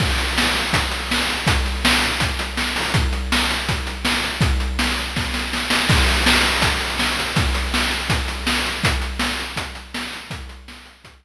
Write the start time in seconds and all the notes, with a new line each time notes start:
0.00 kick, crash
0.18 closed hi-hat
0.38 snare
0.55 closed hi-hat
0.73 kick, closed hi-hat
0.91 closed hi-hat
1.11 snare
1.30 closed hi-hat
1.47 kick, closed hi-hat
1.66 closed hi-hat
1.85 snare
2.02 closed hi-hat
2.20 kick, closed hi-hat
2.39 closed hi-hat
2.57 snare
2.76 open hi-hat
2.94 kick, closed hi-hat
3.13 closed hi-hat
3.32 snare
3.51 closed hi-hat
3.69 kick, closed hi-hat
3.87 closed hi-hat
4.05 snare
4.24 closed hi-hat
4.41 kick, closed hi-hat
4.60 closed hi-hat
4.79 snare
4.98 closed hi-hat
5.16 kick, snare
5.34 snare
5.53 snare
5.70 snare
5.89 kick, crash
6.08 closed hi-hat
6.26 snare
6.44 closed hi-hat
6.62 kick, closed hi-hat
6.81 closed hi-hat
6.99 snare
7.19 closed hi-hat
7.36 kick, closed hi-hat
7.54 closed hi-hat
7.74 snare
7.91 closed hi-hat
8.10 kick, closed hi-hat
8.28 closed hi-hat
8.47 snare
8.66 closed hi-hat
8.84 kick, closed hi-hat
9.02 closed hi-hat
9.19 snare
9.40 closed hi-hat
9.56 kick, closed hi-hat
9.75 closed hi-hat
9.94 snare
10.13 closed hi-hat
10.31 kick, closed hi-hat
10.49 closed hi-hat
10.68 snare
10.86 closed hi-hat
11.04 kick, closed hi-hat
11.23 closed hi-hat